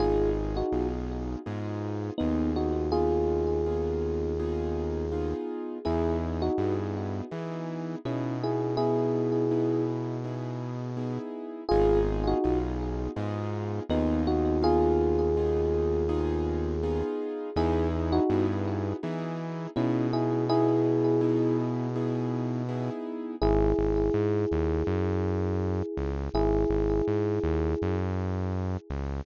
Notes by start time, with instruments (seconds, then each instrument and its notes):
0.00 synth bass 1 G#1, acoustic grand piano B3 D#4 F4 G#4, electric piano 1 F4 G#4
0.57 electric piano 1 D#4 F#4
0.72 synth bass 1 B1, acoustic grand piano B3 D#4 F4 G#4
1.46 synth bass 1 G#2, acoustic grand piano B3 D#4 F4 G#4
2.18 synth bass 1 D#2, electric piano 1 B3 D#4, acoustic grand piano B3 D#4 F4 G#4
2.56 electric piano 1 D#4 F#4
2.92 acoustic grand piano B3 D#4 F4 G#4, electric piano 1 F4 G#4
3.66 acoustic grand piano B3 D#4 F4 G#4
4.39 acoustic grand piano B3 D#4 F4 G#4
5.12 acoustic grand piano B3 D#4 F4 G#4
5.85 synth bass 1 E2, acoustic grand piano B3 D#4 E4 G#4, electric piano 1 E4 G#4
6.42 electric piano 1 D#4 F#4
6.58 synth bass 1 G2, acoustic grand piano B3 D#4 E4 G#4
7.31 synth bass 1 E3, acoustic grand piano B3 D#4 E4 G#4
8.05 synth bass 1 B2, acoustic grand piano B3 D#4 E4 G#4, electric piano 1 C#4 E4
8.44 electric piano 1 E4 G#4
8.77 acoustic grand piano B3 D#4 E4 G#4, electric piano 1 E4 G#4
9.51 acoustic grand piano B3 D#4 E4 G#4
10.24 acoustic grand piano B3 D#4 E4 G#4
10.97 acoustic grand piano B3 D#4 E4 G#4
11.69 synth bass 1 G#1, acoustic grand piano B3 D#4 F4 G#4, electric piano 1 F4 G#4
12.27 electric piano 1 D#4 F#4
12.44 synth bass 1 B1, acoustic grand piano B3 D#4 F4 G#4
13.16 synth bass 1 G#2, acoustic grand piano B3 D#4 F4 G#4
13.89 synth bass 1 D#2, electric piano 1 B3 D#4, acoustic grand piano B3 D#4 F4 G#4
14.27 electric piano 1 D#4 F#4
14.62 acoustic grand piano B3 D#4 F4 G#4, electric piano 1 F4 G#4
15.37 acoustic grand piano B3 D#4 F4 G#4
16.09 acoustic grand piano B3 D#4 F4 G#4
16.83 acoustic grand piano B3 D#4 F4 G#4
17.56 synth bass 1 E2, acoustic grand piano B3 D#4 E4 G#4, electric piano 1 E4 G#4
18.12 electric piano 1 D#4 F#4
18.30 synth bass 1 G2, acoustic grand piano B3 D#4 E4 G#4
19.03 synth bass 1 E3, acoustic grand piano B3 D#4 E4 G#4
19.76 synth bass 1 B2, acoustic grand piano B3 D#4 E4 G#4, electric piano 1 C#4 E4
20.13 electric piano 1 E4 G#4
20.49 acoustic grand piano B3 D#4 E4 G#4, electric piano 1 E4 G#4
21.21 acoustic grand piano B3 D#4 E4 G#4
21.96 acoustic grand piano B3 D#4 E4 G#4
22.69 acoustic grand piano B3 D#4 E4 G#4
23.42 synth bass 1 G#1, electric piano 1 E4 G#4
23.79 synth bass 1 G#1
24.14 synth bass 1 G#2
24.52 synth bass 1 D#2
24.87 synth bass 1 F#2
25.97 synth bass 1 C#2
26.34 synth bass 1 G#1, electric piano 1 E4 G#4
26.70 synth bass 1 G#1
27.07 synth bass 1 G#2
27.43 synth bass 1 D#2
27.82 synth bass 1 F#2
28.90 synth bass 1 C#2